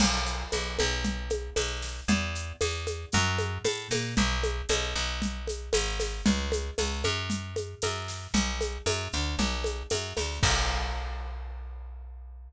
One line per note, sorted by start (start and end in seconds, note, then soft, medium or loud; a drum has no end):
0.00 0.44 B1 medium
0.00 crash loud
0.00 low conga medium
0.00 shaker medium
0.26 shaker medium
0.52 0.78 B1 medium
0.52 tambourine medium
0.52 high conga medium
0.52 shaker medium
0.79 1.50 B1 medium
0.79 high conga medium
0.79 shaker medium
1.04 low conga medium
1.04 shaker medium
1.30 high conga medium
1.30 shaker medium
1.56 2.01 B1 medium
1.56 tambourine medium
1.56 high conga medium
1.56 shaker medium
1.82 snare medium
1.82 shaker medium
2.08 2.53 E2 medium
2.08 low conga loud
2.08 shaker medium
2.35 shaker medium
2.61 3.06 E2 medium
2.61 tambourine medium
2.61 high conga medium
2.61 shaker medium
2.87 high conga medium
2.87 shaker medium
3.12 3.58 F#2 loud
3.12 low conga medium
3.12 shaker medium
3.38 high conga medium
3.38 shaker medium
3.64 3.88 A2 medium
3.64 tambourine medium
3.64 high conga medium
3.64 shaker medium
3.90 4.14 A#2 medium
3.90 snare medium
3.90 high conga medium
3.90 shaker medium
4.17 4.62 B1 loud
4.17 low conga medium
4.17 shaker medium
4.43 high conga medium
4.43 shaker medium
4.69 4.94 B1 medium
4.69 tambourine medium
4.69 high conga medium
4.69 shaker medium
4.95 5.70 B1 medium
4.95 shaker medium
5.22 low conga medium
5.22 shaker medium
5.47 high conga medium
5.47 shaker medium
5.73 6.22 G#1 medium
5.73 tambourine medium
5.73 high conga medium
5.73 shaker medium
6.00 snare medium
6.00 high conga medium
6.00 shaker medium
6.26 6.71 C#2 medium
6.26 low conga loud
6.26 shaker medium
6.52 high conga medium
6.52 shaker medium
6.78 7.03 C#2 medium
6.78 tambourine medium
6.78 high conga medium
6.78 shaker medium
7.04 7.75 F#2 medium
7.04 high conga medium
7.04 shaker medium
7.30 low conga medium
7.30 shaker medium
7.56 high conga medium
7.56 shaker medium
7.82 8.27 F#2 medium
7.82 tambourine medium
7.82 high conga medium
7.82 shaker medium
8.08 snare soft
8.08 shaker medium
8.34 8.78 B1 medium
8.34 low conga medium
8.34 shaker medium
8.61 high conga medium
8.61 shaker medium
8.86 9.08 F#2 medium
8.86 tambourine medium
8.86 high conga medium
8.86 shaker medium
9.12 9.36 D2 medium
9.12 shaker medium
9.39 9.83 B1 medium
9.39 low conga medium
9.39 shaker medium
9.64 high conga medium
9.64 shaker medium
9.90 10.13 F#2 medium
9.90 tambourine medium
9.90 high conga medium
9.90 shaker medium
10.17 10.39 D2 medium
10.17 snare medium
10.17 high conga medium
10.17 shaker medium
10.43 12.49 B1 loud
10.43 kick loud
10.43 crash loud